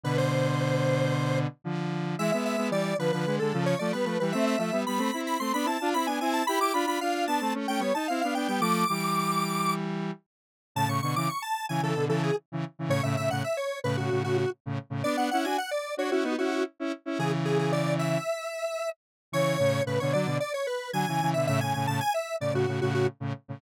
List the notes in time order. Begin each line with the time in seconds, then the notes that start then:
0.04 B2 D3 B4
0.18 C5
1.64 D3 F3
2.19 E3 G#3 E5
2.32 G#3 B3 E5
2.45 E5
2.57 G#3 B3
2.70 E3 G3 D5
2.99 D3 F3 B4
3.12 D3 F3 B4
3.26 D3 G#3
3.39 D3 G#3 A4
3.53 C#3 F3
3.66 C#5
3.79 F3 A3 D5
3.93 G3 B3 B4
4.05 F3 A3 B4
4.20 E3 G3 B4
4.32 A3 C4 E5
4.47 E5
4.58 F3 A3 E5
4.72 G3 B3
4.86 G3 B3 B5
4.98 A3 C4
5.14 C4 E4
5.27 B5
5.40 A3 C4 C6
5.54 B3 D4 B5
5.65 C4 E4 A5
5.81 D4 F4
5.94 C4 E4 B5
6.07 B3 D4 G#5
6.21 C4 E4 G#5
6.33 A5
6.47 E4 G4 B5
6.59 E4 G4 D6
6.74 D4 F4 B5
6.86 D4 F4 B5
7.01 D4 F4 F5
7.27 B3 D4 A5
7.41 A3 C4
7.54 A3 C#4
7.68 A3 C#4 G5
7.79 G3 B3 C#5
7.94 D#4 A5
8.08 C4 E4 F5
8.21 B3 D4 F5
8.35 B3 D4 G5
8.48 G3 B3 G5
8.60 F3 A3 D6
8.89 E3 G3
10.75 A2 C#3 A5
10.87 A2 C#3 C#6
11.02 B2 D3 C#6
11.16 C#3 E3 D6
11.29 C#6
11.42 A5
11.69 C#3 E3 G#5
11.81 C#3 E3 A4
11.95 B2 D3
12.08 C#3 E3 A4
12.23 G#4
12.52 C#3 E3
12.79 C#3 E3
12.88 A2 C#3 C#5
13.03 A2 C#3 E5
13.17 A2 C#3 E5
13.30 A2 C#3 F#5
13.44 E5
13.57 C#5
13.84 A2 C#3 B4
13.97 A2 C#3 F#4
14.10 A2 C#3
14.24 A2 C#3 F#4
14.38 F#4
14.66 A2 C#3
14.90 A2 C#3
15.04 B3 D4 D5
15.17 B3 D4 F#5
15.31 C#4 E4 F#5
15.44 D4 F#4 G#5
15.58 F#5
15.71 D5
15.97 D4 F#4 C#5
16.11 C#4 E4 F#4
16.23 B3 D#4
16.38 C#4 E4 F#4
16.51 F#4
16.80 C#4 E4
17.06 C#4 E4
17.18 C#3 E3 G#4
17.45 G#4
17.59 G#4
17.72 D5
17.99 E5
19.32 C#3 E3 C#5
19.59 A2 C#3
19.86 A2 C#3 B4
20.00 B2 D3 C#5
20.13 D3 F#3 D5
20.26 B2 D3
20.40 D5
20.54 C#5
20.67 B4
20.93 D3 F#3 G#5
21.08 C#3 E3
21.21 C#3 E3
21.34 B2 D3 E5
21.47 A2 C#3 E5
21.60 A2 C#3 G#5
21.74 A2 C#3 G#5
21.87 A2 C#3 A5
22.01 G#5
22.14 E5
22.40 A2 C#3 D5
22.53 A2 C#3 F#4
22.67 A2 C#3
22.81 A2 C#3 F#4
22.94 F#4
23.20 A2 C#3
23.48 A2 C#3